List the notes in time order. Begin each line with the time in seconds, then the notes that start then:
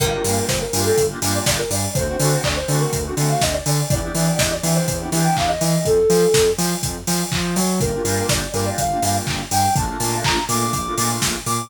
0.00 G1 A#3 D4 F4 G4 A#4, kick, crash
0.12 A#3 D4 F4 G4
0.24 G2 A#3 D4 F4 G4, open hi-hat
0.48 G1 C5, kick, snare
0.61 A#4
0.73 G2 A#3 D4 F4 G4, open hi-hat
0.85 A4
0.98 G1, kick, closed hi-hat
1.10 A#3 D4 F4 G4
1.22 G2 A#3 D4 F4 G4, snare, open hi-hat
1.35 D5
1.46 G1 D5, kick, snare
1.59 A#4
1.70 G2 D5, open hi-hat
1.95 D2 A3 C4 D4 F#4 C5, kick, closed hi-hat
2.07 A3 C4 D4 F#4
2.20 D3 A3 C4 D4 F#4, open hi-hat
2.44 D2 D5, kick, clap
2.56 C5
2.68 D3 A3 C4 D4 F#4, open hi-hat
2.81 A#4
2.93 D2, kick, closed hi-hat
3.05 A3 C4 D4 F#4
3.17 D3 A3 C4 D4 F#4, snare, open hi-hat
3.29 F5
3.41 D2 D#5, kick, snare
3.53 D5
3.66 D3 D5, open hi-hat
3.90 E2 B3 D4 E4 G4 D5, kick, closed hi-hat
4.03 B3 D4 E4 G4
4.15 E3 B3 D4 E4 G4, open hi-hat
4.39 E2 D#5, kick, snare
4.52 D5
4.63 E3 B3 D4 E4 G4, open hi-hat
4.75 C5
4.88 E2, kick, closed hi-hat
5.00 B3 D4 E4 G4
5.12 E3 B3 D4 E4 G4, snare, open hi-hat
5.24 G5
5.37 E2 F5, kick, clap
5.48 D#5
5.61 E3 D#5, open hi-hat
5.85 F2 A4, kick, closed hi-hat
6.10 F3, open hi-hat
6.34 F2, kick, snare
6.58 F3, open hi-hat
6.83 F2, kick, closed hi-hat
7.07 F3, snare, open hi-hat
7.32 F3, kick, clap
7.56 F#3, open hi-hat
7.80 G1 A#3 D4 F4 G4 A#4, kick, closed hi-hat
7.93 A#3 D4 F4 G4
8.05 G2 A#3 D4 F4 G4, open hi-hat
8.29 G1 D5, kick, snare
8.54 G2 A#3 D4 F4 G4 A#4, open hi-hat
8.66 D5
8.78 G1 F5, kick, closed hi-hat
8.90 A#3 D4 F4 G4
9.02 G2 A#3 D4 F4 G4 F5, snare, open hi-hat
9.27 G1, kick, clap
9.51 G2 G5, open hi-hat
9.76 A#1 A3 A#3 D4 F4 A5, kick, closed hi-hat
9.88 A3 A#3 D4 F4
10.00 A#2 A3 A#3 D4 F4, open hi-hat
10.24 A#1 A#5, kick, clap
10.49 A#2 A3 A#3 D4 F4 D6, open hi-hat
10.61 D6
10.73 A#1 D6, kick, closed hi-hat
10.85 A3 A#3 D4 F4
10.97 A#2 A3 A#3 D4 F4 D6, snare, open hi-hat
11.22 A#1, kick, snare
11.46 A#2 D6, open hi-hat